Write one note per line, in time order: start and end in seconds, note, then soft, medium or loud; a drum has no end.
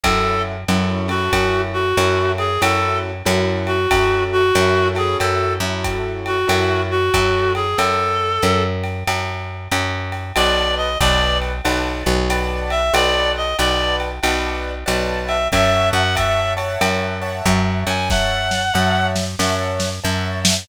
0.03 0.65 F#2 medium
0.03 0.56 C#4 loud
0.03 0.56 E4 loud
0.03 0.56 F#4 loud
0.03 0.42 A4 loud
0.03 0.56 A4 loud
0.03 kick medium
0.03 ride loud
0.68 1.29 F#2 medium
0.68 1.08 C#4 loud
0.68 1.08 E4 loud
0.68 1.08 F#4 loud
0.68 1.08 A4 loud
0.68 hi-hat pedal medium
0.68 ride medium
1.08 1.82 C#4 loud
1.08 1.82 E4 loud
1.08 1.82 F#4 loud
1.08 1.61 F#4 medium
1.08 1.82 A4 loud
1.08 ride medium
1.33 1.93 F#2 medium
1.33 kick medium
1.33 ride loud
1.73 2.31 F#4 medium
1.97 2.58 F#2 medium
1.97 2.47 C#4 loud
1.97 2.47 E4 loud
1.97 2.47 F#4 loud
1.97 2.47 A4 loud
1.97 hi-hat pedal medium
1.97 ride medium
2.38 2.61 G#4 medium
2.38 ride medium
2.61 3.23 F#2 medium
2.61 3.12 C#4 loud
2.61 3.12 E4 loud
2.61 3.12 F#4 loud
2.61 3.12 A4 loud
2.61 2.99 A4 medium
2.61 ride loud
3.25 3.87 F#2 loud
3.25 3.76 C#4 loud
3.25 3.76 E4 loud
3.25 3.76 F#4 loud
3.25 3.76 A4 loud
3.25 hi-hat pedal loud
3.25 ride medium
3.67 4.24 F#4 medium
3.67 ride medium
3.91 4.52 F#2 medium
3.91 4.42 C#4 loud
3.91 4.42 E4 loud
3.91 4.42 F#4 loud
3.91 4.42 A4 loud
3.91 kick medium
3.91 ride loud
4.32 4.88 F#4 loud
4.55 5.16 F#2 medium
4.55 4.94 C#4 loud
4.55 4.94 E4 loud
4.55 4.94 F#4 loud
4.55 4.94 A4 loud
4.55 hi-hat pedal medium
4.55 ride medium
4.95 5.55 C#4 loud
4.95 5.55 E4 loud
4.95 5.55 F#4 loud
4.95 5.17 G#4 medium
4.95 5.55 A4 loud
4.95 ride medium
5.20 5.59 F#2 medium
5.20 5.54 A4 medium
5.20 ride medium
5.60 6.45 F#2 medium
5.60 6.36 C#4 loud
5.60 6.36 E4 loud
5.60 6.36 F#4 loud
5.60 6.36 A4 loud
5.84 kick medium
5.84 hi-hat pedal medium
5.84 ride medium
6.26 6.82 F#4 medium
6.26 ride medium
6.48 7.10 F#2 medium
6.48 6.98 C#4 loud
6.48 6.98 E4 loud
6.48 6.98 F#4 loud
6.48 6.98 A4 loud
6.48 ride loud
6.91 7.53 F#4 medium
7.14 7.75 F#2 medium
7.14 7.64 C#4 loud
7.14 7.64 E4 loud
7.14 7.64 F#4 loud
7.14 7.64 A4 loud
7.14 kick medium
7.14 hi-hat pedal medium
7.14 ride medium
7.55 7.78 G#4 medium
7.55 ride medium
7.77 8.39 F#2 medium
7.77 8.63 A4 loud
7.77 ride loud
8.42 9.04 F#2 medium
8.42 hi-hat pedal medium
8.42 ride medium
8.84 ride medium
9.07 9.68 F#2 medium
9.07 ride loud
9.72 10.32 F#2 medium
9.72 hi-hat pedal medium
9.72 ride medium
10.12 ride medium
10.36 10.97 B1 medium
10.36 10.88 B4 loud
10.36 10.75 D5 loud
10.36 10.88 D5 loud
10.36 10.88 F#5 loud
10.36 10.88 A5 loud
10.36 ride loud
10.77 10.98 D#5 medium
11.00 11.61 B1 loud
11.00 11.51 B4 loud
11.00 11.38 D5 loud
11.00 11.51 D5 loud
11.00 11.51 F#5 loud
11.00 11.51 A5 loud
11.00 kick medium
11.00 hi-hat pedal medium
11.00 ride medium
11.42 ride medium
11.65 12.04 B1 medium
11.65 12.15 B4 loud
11.65 12.15 D5 loud
11.65 12.15 F#5 loud
11.65 12.15 A5 loud
11.65 ride medium
12.06 12.91 B1 medium
12.30 12.81 B4 loud
12.30 12.81 D5 loud
12.30 12.81 F#5 loud
12.30 12.81 A5 loud
12.30 hi-hat pedal medium
12.30 ride medium
12.70 12.93 E5 medium
12.70 ride medium
12.94 13.54 B1 medium
12.94 13.45 B4 loud
12.94 13.45 D5 loud
12.94 13.32 D5 medium
12.94 13.45 F#5 loud
12.94 13.45 A5 loud
12.94 ride loud
13.37 13.57 D#5 medium
13.59 14.20 B1 medium
13.59 14.10 B4 loud
13.59 13.96 D5 medium
13.59 14.10 D5 loud
13.59 14.10 F#5 loud
13.59 14.10 A5 loud
13.59 hi-hat pedal medium
13.59 ride medium
14.00 ride medium
14.23 14.84 B1 medium
14.23 14.73 B4 loud
14.23 14.73 D5 loud
14.23 14.73 F#5 loud
14.23 14.73 A5 loud
14.23 ride loud
14.86 15.48 B1 medium
14.86 15.36 B4 loud
14.86 15.36 D5 loud
14.86 15.36 F#5 loud
14.86 15.36 A5 loud
14.86 hi-hat pedal medium
14.86 ride medium
15.27 15.48 E5 medium
15.27 ride medium
15.52 15.91 F#2 medium
15.52 16.03 C#5 loud
15.52 16.03 E5 loud
15.52 15.89 E5 loud
15.52 16.03 F#5 loud
15.52 16.03 A5 loud
15.52 kick medium
15.52 ride medium
15.93 16.77 F#2 medium
15.93 16.15 F#5 loud
16.15 16.54 C#5 loud
16.15 16.54 E5 loud
16.15 16.53 E5 medium
16.15 16.54 F#5 loud
16.15 16.54 A5 loud
16.15 kick medium
16.15 hi-hat pedal medium
16.15 ride medium
16.57 17.17 C#5 loud
16.57 17.17 E5 loud
16.57 17.17 F#5 loud
16.57 17.17 A5 loud
16.57 ride medium
16.81 17.42 F#2 medium
16.81 ride loud
17.22 17.96 C#5 loud
17.22 17.96 E5 loud
17.22 17.96 F#5 loud
17.22 17.96 A5 loud
17.46 17.84 F#2 loud
17.46 kick medium
17.46 hi-hat pedal loud
17.46 ride medium
17.87 18.71 F#2 medium
17.87 18.09 G#5 medium
17.87 ride medium
18.10 18.62 C#5 loud
18.10 18.62 E5 loud
18.10 19.07 F#5 medium
18.10 18.62 F#5 loud
18.10 18.62 A5 loud
18.10 kick medium
18.10 snare medium
18.51 snare medium
18.74 19.36 F#2 medium
18.74 19.24 C#5 loud
18.74 19.24 E5 loud
18.74 19.24 F#5 loud
18.74 19.24 A5 loud
19.16 snare medium
19.39 20.00 F#2 medium
19.39 19.89 C#5 loud
19.39 19.89 E5 loud
19.39 19.89 F#5 loud
19.39 19.89 A5 loud
19.39 snare medium
19.80 snare medium
20.04 20.65 F#2 medium
20.04 20.54 C#5 loud
20.04 20.54 E5 loud
20.04 20.54 F#5 loud
20.04 20.54 A5 loud
20.45 snare loud